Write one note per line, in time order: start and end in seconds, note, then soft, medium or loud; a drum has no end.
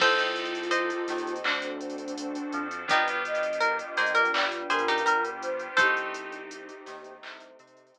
0.00 0.92 C2 medium
0.00 0.58 C4 medium
0.00 1.43 C4 medium
0.00 0.58 D#4 medium
0.00 1.43 D#4 medium
0.00 1.34 F4 medium
0.00 0.58 G4 medium
0.00 1.43 G4 medium
0.00 0.58 A4 medium
0.00 1.43 A4 medium
0.00 1.34 A4 medium
0.00 0.66 A4 medium
0.00 0.66 C5 loud
0.00 kick medium
0.00 crash medium
0.19 closed hi-hat medium
0.36 closed hi-hat medium
0.45 closed hi-hat medium
0.55 closed hi-hat medium
0.63 closed hi-hat medium
0.71 1.99 C5 medium
0.71 1.99 D#5 medium
0.71 closed hi-hat medium
0.90 closed hi-hat medium
1.08 1.39 D#2 medium
1.08 1.40 D#3 medium
1.08 snare soft
1.08 closed hi-hat medium
1.18 closed hi-hat medium
1.27 closed hi-hat medium
1.36 closed hi-hat medium
1.44 2.37 D2 medium
1.44 1.59 C4 medium
1.44 2.88 C4 medium
1.44 1.59 D4 medium
1.44 2.66 D4 medium
1.44 2.88 D4 medium
1.44 1.59 F#4 medium
1.44 2.88 F#4 medium
1.44 1.59 A4 medium
1.44 2.88 A4 medium
1.44 clap medium
1.62 closed hi-hat medium
1.81 closed hi-hat medium
1.90 closed hi-hat medium
1.98 closed hi-hat medium
2.08 closed hi-hat medium
2.18 closed hi-hat loud
2.35 closed hi-hat medium
2.52 2.84 F2 medium
2.52 2.84 F3 medium
2.52 closed hi-hat medium
2.71 closed hi-hat medium
2.88 3.81 G1 loud
2.88 3.45 B3 medium
2.88 5.75 B3 medium
2.88 3.45 D4 medium
2.88 5.75 D4 medium
2.88 3.08 D#4 medium
2.88 3.45 F4 medium
2.88 5.75 F4 medium
2.88 3.45 G4 medium
2.88 5.75 G4 medium
2.88 3.08 G4 medium
2.88 3.23 B4 medium
2.88 kick medium
2.88 closed hi-hat loud
3.08 closed hi-hat medium
3.25 4.19 D#5 medium
3.25 closed hi-hat medium
3.35 closed hi-hat medium
3.43 closed hi-hat medium
3.53 closed hi-hat medium
3.61 3.78 A#4 medium
3.61 closed hi-hat medium
3.79 closed hi-hat medium
3.97 4.28 A#1 medium
3.97 4.27 A#3 medium
3.97 4.15 G#4 medium
3.97 4.15 C5 medium
3.97 snare soft
3.97 closed hi-hat medium
4.06 closed hi-hat medium
4.15 4.32 A#4 medium
4.15 closed hi-hat medium
4.25 closed hi-hat medium
4.33 4.64 G1 medium
4.33 4.64 G3 medium
4.33 4.64 D5 medium
4.33 clap loud
4.52 closed hi-hat medium
4.70 5.01 G2 medium
4.70 5.01 G3 medium
4.70 4.87 G#4 medium
4.70 5.30 A#4 medium
4.70 4.87 C5 medium
4.70 closed hi-hat medium
4.79 closed hi-hat medium
4.88 5.06 D#4 medium
4.88 5.06 G4 medium
4.88 closed hi-hat medium
4.98 closed hi-hat medium
5.05 5.67 G1 medium
5.05 5.67 G3 medium
5.05 5.23 A#4 medium
5.05 closed hi-hat loud
5.25 closed hi-hat medium
5.42 5.77 C5 medium
5.42 closed hi-hat medium
5.59 closed hi-hat medium
5.77 6.70 C2 medium
5.77 6.36 A3 medium
5.77 7.99 A3 medium
5.77 6.36 C4 medium
5.77 7.99 C4 medium
5.77 6.36 D#4 medium
5.77 7.13 D#4 medium
5.77 7.99 D#4 medium
5.77 6.36 G4 medium
5.77 7.13 G4 medium
5.77 7.99 G4 medium
5.77 6.66 A4 medium
5.77 6.66 C5 medium
5.77 kick medium
5.77 closed hi-hat loud
5.97 closed hi-hat medium
6.14 closed hi-hat medium
6.32 closed hi-hat medium
6.51 closed hi-hat medium
6.69 closed hi-hat medium
6.86 7.18 D#2 medium
6.86 7.17 D#3 medium
6.86 snare soft
6.86 closed hi-hat medium
7.04 closed hi-hat medium
7.22 7.53 C2 medium
7.22 7.53 C3 medium
7.22 clap loud
7.40 closed hi-hat medium
7.59 7.90 C3 medium
7.59 7.90 C4 medium
7.59 closed hi-hat medium
7.67 closed hi-hat medium
7.77 closed hi-hat medium
7.87 closed hi-hat medium
7.94 7.99 C2 medium
7.94 7.99 C3 medium
7.94 closed hi-hat medium